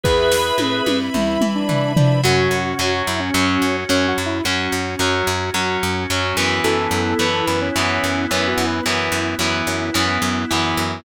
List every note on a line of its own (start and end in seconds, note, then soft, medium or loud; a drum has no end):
0.04 0.52 E2 medium
0.04 2.19 E4 medium
0.04 0.98 G#4 medium
0.04 2.19 B4 medium
0.04 0.98 B4 medium
0.04 0.83 B4 medium
0.04 2.22 E5 medium
0.04 2.22 B5 loud
0.04 kick medium
0.32 snare medium
0.58 0.81 A2 medium
0.58 high tom medium
0.86 1.10 G2 medium
0.86 high tom loud
1.14 1.38 E2 medium
1.14 1.51 E4 medium
1.14 mid tom medium
1.41 1.65 E3 medium
1.41 mid tom loud
1.55 1.92 D4 medium
1.69 1.94 E3 medium
1.69 floor tom loud
1.96 2.22 F3 medium
1.96 2.21 D4 medium
1.96 floor tom loud
2.24 2.48 F#2 medium
2.24 2.73 F#3 medium
2.24 4.23 C#4 loud
2.24 6.60 C#4 loud
2.24 2.73 C#4 medium
2.24 3.03 F#4 medium
2.24 4.23 F#4 loud
2.24 6.60 F#4 medium
2.51 2.74 F#2 medium
2.79 3.02 F#2 medium
2.79 3.29 F#3 medium
2.79 3.29 C#4 medium
3.07 3.31 F#2 medium
3.07 3.20 E4 medium
3.20 3.77 C#4 medium
3.34 3.58 F#2 loud
3.34 3.84 F#3 medium
3.34 3.84 C#4 medium
3.62 3.85 F#2 medium
3.89 4.13 F#2 medium
3.89 4.39 F#3 medium
3.89 4.07 C#4 medium
3.89 4.39 C#4 medium
4.08 4.25 F#4 medium
4.18 4.41 F#2 medium
4.26 4.43 E4 medium
4.44 4.68 F#2 medium
4.44 4.95 F#3 medium
4.44 6.42 C#4 medium
4.44 4.95 C#4 medium
4.44 6.42 F#4 medium
4.72 4.96 F#2 medium
4.99 5.23 F#2 medium
4.99 5.50 F#3 medium
4.99 5.50 C#4 medium
5.27 5.51 F#2 medium
5.54 5.77 F#2 medium
5.54 6.04 F#3 medium
5.54 6.04 C#4 medium
5.83 6.06 F#2 medium
6.10 6.33 F#2 medium
6.10 6.36 F#3 medium
6.10 6.36 C#4 medium
6.37 6.60 F#2 medium
6.37 7.14 E3 medium
6.37 7.14 B3 medium
6.64 6.88 F#2 medium
6.64 8.62 B3 loud
6.64 11.01 B3 medium
6.64 8.62 E4 loud
6.64 11.01 E4 loud
6.64 7.45 A4 medium
6.91 7.14 F#2 medium
7.19 7.42 F#2 medium
7.19 7.69 E3 medium
7.19 7.69 B3 medium
7.47 7.71 F#2 medium
7.47 7.60 B4 medium
7.61 8.26 C#4 medium
7.76 7.99 F#2 medium
7.76 8.25 E3 medium
7.76 8.25 B3 medium
8.04 8.27 F#2 medium
8.31 8.54 F#2 medium
8.31 8.80 E3 medium
8.31 8.80 B3 medium
8.31 8.48 C#4 medium
8.48 8.65 F#4 medium
8.58 8.81 F#2 medium
8.67 8.84 B4 medium
8.83 9.09 F#2 medium
8.83 9.35 E3 medium
8.83 10.82 B3 loud
8.83 9.35 B3 medium
8.83 10.82 E4 medium
9.12 9.35 F#2 medium
9.39 9.62 F#2 medium
9.39 9.90 E3 medium
9.39 9.90 B3 medium
9.67 9.90 F#2 medium
9.94 10.18 F#2 loud
9.94 10.44 E3 medium
9.94 10.44 B3 medium
10.22 10.45 F#2 medium
10.51 10.75 F#2 medium
10.51 11.00 E3 medium
10.51 11.00 B3 medium
10.77 11.01 F#2 medium